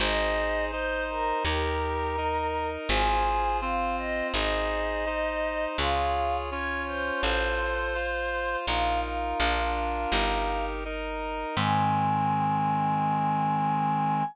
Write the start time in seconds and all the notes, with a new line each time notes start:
0.00 G#1 D#4 G#4 C5 D#5
0.71 D#4 C5 D#5
1.10 A#4
1.45 D#2 D#4 G4 A#4
2.17 D#4 A#4 D#5
2.89 G#1 F4 G#4 C5 G#5
3.61 C4 F4 C5 F5
3.98 D#5
4.34 G#1 D#4 G#4 C5 D#5
5.06 D#4 C5 D#5
5.78 C#2 F4 G#4 C#5 F5
6.51 C#4 F4 C#5
6.86 C5
7.23 A1 F4 A4 C5
7.95 F4 C5 F5
8.67 A#1 D#4 F4 A#4 F5
9.03 F5
9.40 A#1 D4 F4 A#4
10.12 G1 D#4 G4 A#4
10.84 D#4 A#4 D#5
11.56 G#2 D#3 G#3 C4 G#5